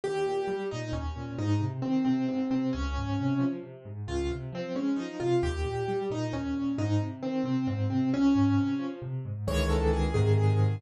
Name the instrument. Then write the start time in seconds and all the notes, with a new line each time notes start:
acoustic grand piano
0.04 D#2 G4
0.26 A#2
0.48 G3
0.71 A#2 D#4
0.93 D#2 C#4
1.16 A#2
1.38 G#2 D#4
1.60 C3
1.82 D#3 C4
2.05 C3 C4
2.28 G#2 C4
2.50 C3 C4
2.73 C#2 C#4
2.97 G#2
3.20 C3
3.39 F3
3.63 C3
3.85 G#2
4.07 C#2 F4
4.31 C3
4.52 F3 C4
4.75 G#3 C#4
4.96 F3 D#4
5.20 C3 F4
5.43 D#2 G4
5.65 A#2
5.88 G3
6.10 A#2 D#4
6.33 D#2 C#4
6.53 A#2
6.78 G#2 D#4
7.00 C3
7.23 D#3 C4
7.43 C3 C4
7.67 G#2 C4
7.90 C3 C4
8.13 C#2 C#4
8.35 G#2
8.57 C3
8.79 F3
9.02 C3
9.25 G#2
9.47 C#2 D#3 E3 G#3 C#5
9.70 A4
9.93 G#4
10.14 G#2 C3 D#3 G#4
10.38 G#4